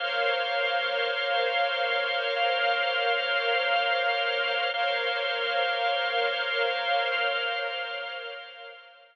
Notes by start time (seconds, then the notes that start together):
0.00 A#3 A#4 C5 C#5 F5
2.36 A#3 A#4 C5 F5
4.74 A#3 A#4 C5 C#5 F5
7.12 A#3 A#4 C5 F5